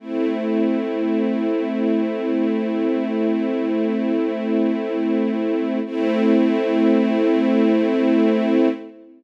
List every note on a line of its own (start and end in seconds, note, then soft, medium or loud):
0.00 5.79 A3 medium
0.00 5.79 C4 medium
0.00 5.79 E4 medium
5.85 8.68 A3 loud
5.85 8.68 C4 loud
5.85 8.68 E4 loud